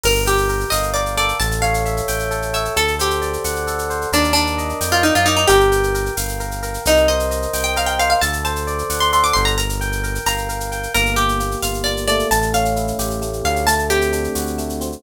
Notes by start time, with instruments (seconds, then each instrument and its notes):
0.04 synth bass 1 G1, electric piano 1 A#4, acoustic guitar (steel) A#4, crash
0.15 shaker
0.26 acoustic guitar (steel) G4, electric piano 1 G5, shaker
0.38 shaker
0.49 electric piano 1 A#4, shaker
0.60 shaker
0.70 synth bass 1 G1, acoustic guitar (steel) D#5, electric piano 1 F5, tambourine, shaker
0.83 shaker
0.94 electric piano 1 A#4, acoustic guitar (steel) D5, shaker
1.06 shaker
1.17 electric piano 1 A4, acoustic guitar (steel) D5, shaker
1.29 shaker
1.39 synth bass 1 A1, acoustic guitar (steel) A5, shaker
1.51 shaker
1.62 electric piano 1 C#5, acoustic guitar (steel) F5, shaker
1.74 shaker
1.85 electric piano 1 E5, shaker
1.97 shaker
2.08 synth bass 1 A1, electric piano 1 G5, tambourine, shaker
2.20 shaker
2.31 electric piano 1 A4, shaker
2.42 shaker
2.53 electric piano 1 C#5, acoustic guitar (steel) E5, shaker
2.65 shaker
2.76 synth bass 1 D2, electric piano 1 A4, acoustic guitar (steel) A4, shaker
2.88 shaker
2.99 acoustic guitar (steel) G4, electric piano 1 C5, shaker
3.10 shaker
3.22 electric piano 1 D5, shaker
3.33 shaker
3.44 synth bass 1 D2, electric piano 1 F#5, tambourine, shaker
3.56 shaker
3.67 electric piano 1 A4, shaker
3.79 shaker
3.90 electric piano 1 C5, shaker
4.01 shaker
4.12 synth bass 1 D#2, acoustic guitar (steel) D4, electric piano 1 A#4, shaker
4.24 shaker
4.33 acoustic guitar (steel) D4, electric piano 1 D5, shaker
4.47 shaker
4.58 electric piano 1 D#5, shaker
4.69 shaker
4.81 synth bass 1 F2, electric piano 1 G5, tambourine, shaker
4.92 acoustic guitar (steel) F4, shaker
5.03 acoustic guitar (steel) D#4, electric piano 1 A#4, shaker
5.15 synth bass 1 F#2, acoustic guitar (steel) F4, shaker
5.26 acoustic guitar (steel) D#4, electric piano 1 D5, shaker
5.37 acoustic guitar (steel) D#4, shaker
5.47 synth bass 1 G1, acoustic guitar (steel) G4, electric piano 1 A#4, shaker
5.60 shaker
5.72 electric piano 1 G5, shaker
5.83 shaker
5.94 electric piano 1 A#4, shaker
6.06 shaker
6.17 synth bass 1 G1, electric piano 1 F5, tambourine, shaker
6.29 shaker
6.40 electric piano 1 A#4, shaker
6.51 shaker
6.62 electric piano 1 A#4, shaker
6.74 shaker
6.85 synth bass 1 C2, acoustic guitar (steel) D#4, shaker
6.97 shaker
7.08 electric piano 1 C5, acoustic guitar (steel) D#5, shaker
7.20 shaker
7.31 electric piano 1 D#5, shaker
7.42 shaker
7.53 synth bass 1 C2, electric piano 1 G5, tambourine, shaker
7.64 acoustic guitar (steel) G5, shaker
7.76 electric piano 1 A#4, acoustic guitar (steel) F5, shaker
7.86 acoustic guitar (steel) G5, shaker
7.99 electric piano 1 C5, acoustic guitar (steel) F5, shaker
8.10 acoustic guitar (steel) F5, shaker
8.21 synth bass 1 D2, electric piano 1 A4, acoustic guitar (steel) A5, shaker
8.33 shaker
8.44 electric piano 1 C5, acoustic guitar (steel) A5, shaker
8.56 shaker
8.67 electric piano 1 D5, shaker
8.78 shaker
8.90 synth bass 1 D2, electric piano 1 F#5, tambourine, shaker
9.00 acoustic guitar (steel) C6, shaker
9.12 electric piano 1 A4, acoustic guitar (steel) C6, shaker
9.24 acoustic guitar (steel) D6, shaker
9.33 synth bass 1 G1, electric piano 1 C5, acoustic guitar (steel) C6, shaker
9.45 acoustic guitar (steel) A#5, shaker
9.58 electric piano 1 A#4, acoustic guitar (steel) A#5, shaker
9.69 shaker
9.81 electric piano 1 G5, shaker
9.92 shaker
10.03 electric piano 1 A#4, shaker
10.15 shaker
10.26 synth bass 1 G1, electric piano 1 F5, acoustic guitar (steel) A#5, tambourine, shaker
10.38 shaker
10.49 electric piano 1 A#4, shaker
10.60 shaker
10.72 electric piano 1 G5, shaker
10.83 shaker
10.94 synth bass 1 G1, electric piano 1 A#3, acoustic guitar (steel) A#4, shaker
11.06 shaker
11.16 acoustic guitar (steel) G4, electric piano 1 G4, shaker
11.29 shaker
11.40 electric piano 1 A#3, shaker
11.51 shaker
11.62 synth bass 1 G1, electric piano 1 F4, acoustic guitar (steel) F5, tambourine, shaker
11.74 shaker
11.84 electric piano 1 A#3, acoustic guitar (steel) D5, shaker
11.97 shaker
12.07 electric piano 1 A3, acoustic guitar (steel) D5, shaker
12.19 shaker
12.31 synth bass 1 A1, acoustic guitar (steel) A5, shaker
12.42 shaker
12.53 electric piano 1 C#4, acoustic guitar (steel) F5, shaker
12.65 shaker
12.76 electric piano 1 E4, shaker
12.87 shaker
12.99 synth bass 1 A1, electric piano 1 G4, tambourine, shaker
13.10 shaker
13.22 electric piano 1 A3, shaker
13.33 shaker
13.44 synth bass 1 D2, electric piano 1 C#4, acoustic guitar (steel) F5, shaker
13.56 shaker
13.67 electric piano 1 A3, acoustic guitar (steel) A5, shaker
13.79 shaker
13.90 electric piano 1 C4, acoustic guitar (steel) G4, shaker
14.01 shaker
14.12 electric piano 1 D4, shaker
14.24 shaker
14.35 synth bass 1 D2, electric piano 1 F#4, tambourine, shaker
14.47 shaker
14.58 electric piano 1 A3, shaker
14.69 shaker
14.81 electric piano 1 C4, shaker
14.92 shaker